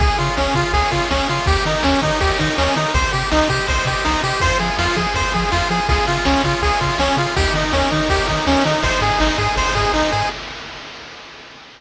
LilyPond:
<<
  \new Staff \with { instrumentName = "Lead 1 (square)" } { \time 4/4 \key aes \major \tempo 4 = 163 aes'8 f'8 des'8 f'8 aes'8 f'8 des'8 f'8 | g'8 ees'8 des'8 ees'8 g'8 ees'8 des'8 ees'8 | c''8 g'8 ees'8 g'8 c''8 g'8 ees'8 g'8 | c''8 aes'8 f'8 aes'8 c''8 aes'8 f'8 aes'8 |
aes'8 f'8 des'8 f'8 aes'8 f'8 des'8 f'8 | g'8 ees'8 des'8 ees'8 g'8 ees'8 des'8 ees'8 | c''8 aes'8 ees'8 aes'8 c''8 aes'8 ees'8 aes'8 | }
  \new Staff \with { instrumentName = "Lead 1 (square)" } { \time 4/4 \key aes \major aes'8 des''8 f''8 aes'8 des''8 f''8 aes'8 des''8 | g'8 bes'8 des''8 ees''8 g'8 bes'8 des''8 ees''8 | g'8 c''8 ees''8 g'8 c''8 ees''8 g'8 c''8 | f'8 aes'8 c''8 f'8 aes'8 c''8 f'8 aes'8 |
f'8 aes'8 des''8 f'8 aes'8 des''8 f'8 aes'8 | ees'8 g'8 bes'8 des''8 ees'8 g'8 bes'8 des''8 | ees'8 aes'8 c''8 ees'8 aes'8 c''8 ees'8 aes'8 | }
  \new Staff \with { instrumentName = "Synth Bass 1" } { \clef bass \time 4/4 \key aes \major des,8 des8 des,8 des8 des,8 des8 des,8 des8 | ees,8 ees8 ees,8 ees8 ees,8 ees8 ees,8 ees8 | c,8 c8 c,8 c8 c,8 c8 c,8 c8 | f,8 f8 f,8 f8 f,8 f8 f,8 f8 |
des,8 des8 des,8 des8 des,8 des8 des,8 des8 | ees,8 ees8 ees,8 ees8 ees,8 ees8 ees,8 ees8 | aes,,8 aes,8 aes,,8 aes,8 aes,,8 aes,8 aes,,8 aes,8 | }
  \new DrumStaff \with { instrumentName = "Drums" } \drummode { \time 4/4 <bd cymr>8 cymr8 sn8 <bd cymr>8 <bd cymr>8 <bd cymr>8 sn8 cymr8 | <bd cymr>8 cymr8 sn8 <bd cymr>8 <bd cymr>8 <bd cymr>8 sn8 cymr8 | <bd cymr>8 cymr8 sn8 <bd cymr>8 <bd cymr>8 <bd cymr>8 sn8 cymr8 | <bd cymr>8 cymr8 sn8 <bd cymr>8 <bd cymr>8 <bd cymr>8 sn8 cymr8 |
<bd cymr>8 cymr8 sn8 <bd cymr>8 <bd cymr>8 <bd cymr>8 sn8 cymr8 | <bd cymr>8 cymr8 sn8 <bd cymr>8 <bd cymr>8 <bd cymr>8 sn8 cymr8 | <bd cymr>8 cymr8 sn8 <bd cymr>8 <bd cymr>8 <bd cymr>8 sn8 cymr8 | }
>>